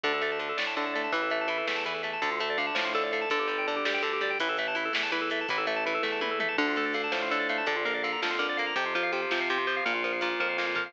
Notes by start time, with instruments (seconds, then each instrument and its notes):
0.03 synth bass 1 D2, acoustic guitar (steel) D3, drawbar organ D4, kick, ride
0.14 drawbar organ A4
0.21 acoustic guitar (steel) A3, drawbar organ D5, ride
0.32 drawbar organ A5
0.39 acoustic guitar (steel) D3, drawbar organ D4, ride
0.49 drawbar organ A4
0.57 synth bass 1 A2, acoustic guitar (steel) A3, drawbar organ D5, snare
0.67 drawbar organ A5
0.77 acoustic guitar (steel) D3, drawbar organ D4, ride
0.86 drawbar organ A4
0.93 acoustic guitar (steel) A3, drawbar organ D5, ride
1.04 drawbar organ A5
1.12 synth bass 1 A1, acoustic guitar (steel) E3, drawbar organ E4, kick, ride
1.22 drawbar organ A4
1.30 acoustic guitar (steel) A3, drawbar organ E5, ride
1.41 drawbar organ A5
1.48 acoustic guitar (steel) E3, drawbar organ E4, ride
1.58 drawbar organ A4
1.67 synth bass 1 E2, acoustic guitar (steel) A3, drawbar organ E5, snare
1.76 drawbar organ A5
1.84 acoustic guitar (steel) E3, drawbar organ E4, ride
1.94 drawbar organ A4
2.03 acoustic guitar (steel) A3, drawbar organ E5, ride
2.13 drawbar organ A5
2.22 synth bass 1 D2, acoustic guitar (steel) D3, drawbar organ D4, kick, ride
2.31 drawbar organ F4
2.40 acoustic guitar (steel) A3, drawbar organ A4, ride
2.50 drawbar organ D5
2.58 acoustic guitar (steel) D3, drawbar organ F5, ride
2.67 drawbar organ A5
2.75 synth bass 1 A2, acoustic guitar (steel) F3, drawbar organ D4, snare
2.85 drawbar organ F4
2.95 acoustic guitar (steel) D3, drawbar organ A4, ride
3.03 drawbar organ D5
3.12 acoustic guitar (steel) A3, drawbar organ F5, ride
3.21 drawbar organ A5
3.30 synth bass 1 G1, acoustic guitar (steel) D3, drawbar organ D4, kick, ride
3.39 drawbar organ G4
3.48 acoustic guitar (steel) G3, drawbar organ D5, ride
3.58 drawbar organ G5
3.67 acoustic guitar (steel) D3, drawbar organ D4, ride
3.76 drawbar organ G4
3.85 synth bass 1 D2, acoustic guitar (steel) G3, drawbar organ D5, snare
3.94 drawbar organ G5
4.03 acoustic guitar (steel) D3, drawbar organ D4, ride
4.13 drawbar organ G4
4.21 acoustic guitar (steel) G3, drawbar organ D5, ride
4.30 drawbar organ G5
4.39 synth bass 1 A1, acoustic guitar (steel) E3, drawbar organ E4, kick, ride
4.49 drawbar organ A4
4.57 acoustic guitar (steel) A3, drawbar organ E5, ride
4.68 drawbar organ A5
4.75 acoustic guitar (steel) E3, drawbar organ E4, ride
4.85 drawbar organ A4
4.93 synth bass 1 E2, acoustic guitar (steel) A3, drawbar organ E5, snare
5.03 drawbar organ A5
5.12 acoustic guitar (steel) E3, drawbar organ E4, ride
5.21 drawbar organ A4
5.30 acoustic guitar (steel) A3, drawbar organ E5, ride
5.41 drawbar organ A5
5.48 synth bass 1 A1, acoustic guitar (steel) E3, drawbar organ E4, kick, ride
5.58 drawbar organ A4
5.67 acoustic guitar (steel) A3, drawbar organ E5, ride
5.76 drawbar organ A5
5.86 acoustic guitar (steel) E3, drawbar organ E4, ride
5.94 drawbar organ A4
6.03 synth bass 1 E2, acoustic guitar (steel) A3, drawbar organ E5, kick, snare
6.12 drawbar organ A5
6.21 acoustic guitar (steel) E3, drawbar organ E4, high tom
6.31 drawbar organ A4
6.40 acoustic guitar (steel) A3, drawbar organ E5, mid tom
6.48 drawbar organ A5
6.58 synth bass 1 D2, acoustic guitar (steel) D3, drawbar organ D4, kick, crash
6.68 drawbar organ F4
6.76 acoustic guitar (steel) A3, drawbar organ A4, ride
6.85 drawbar organ D5
6.94 acoustic guitar (steel) D3, drawbar organ F5, ride
7.04 drawbar organ A5
7.12 synth bass 1 A2, acoustic guitar (steel) F3, drawbar organ D4, snare
7.22 drawbar organ F4
7.31 acoustic guitar (steel) D3, drawbar organ A4, ride
7.40 drawbar organ D5
7.49 acoustic guitar (steel) A3, drawbar organ F5, ride
7.58 drawbar organ A5
7.66 synth bass 1 A#1, acoustic guitar (steel) D3, drawbar organ D4, kick, ride
7.76 drawbar organ F4
7.85 acoustic guitar (steel) A#3, drawbar organ A#4, ride
7.94 drawbar organ D5
8.03 acoustic guitar (steel) D3, drawbar organ F5, ride
8.12 drawbar organ A#5
8.22 synth bass 1 F2, acoustic guitar (steel) F3, drawbar organ D4, snare
8.31 drawbar organ F4
8.39 acoustic guitar (steel) D3, drawbar organ A#4, ride
8.49 drawbar organ D5
8.57 acoustic guitar (steel) A#3, drawbar organ F5, ride
8.67 drawbar organ A#5
8.76 synth bass 1 F2, acoustic guitar (steel) C3, drawbar organ C4, kick, ride
8.86 drawbar organ F4
8.95 acoustic guitar (steel) F3, drawbar organ C5, ride
9.03 drawbar organ F5
9.12 acoustic guitar (steel) C3, drawbar organ C4, ride
9.22 drawbar organ F4
9.31 synth bass 1 C3, acoustic guitar (steel) F3, drawbar organ C5, snare
9.41 drawbar organ F5
9.49 acoustic guitar (steel) C3, drawbar organ C4, ride
9.58 drawbar organ F4
9.67 acoustic guitar (steel) F3, drawbar organ C5, ride
9.76 drawbar organ F5
9.85 synth bass 1 A#1, acoustic guitar (steel) A#2, drawbar organ A#3, kick, ride
9.95 drawbar organ F4
10.04 acoustic guitar (steel) F3, drawbar organ A#4, ride
10.13 drawbar organ F5
10.21 acoustic guitar (steel) A#2, drawbar organ A#3, ride
10.31 drawbar organ F4
10.40 synth bass 1 F2, acoustic guitar (steel) F3, drawbar organ A#4, kick
10.49 drawbar organ F5
10.58 acoustic guitar (steel) A#2, drawbar organ A#3, snare
10.67 drawbar organ F4
10.75 acoustic guitar (steel) F3, drawbar organ A#4, floor tom
10.86 drawbar organ F5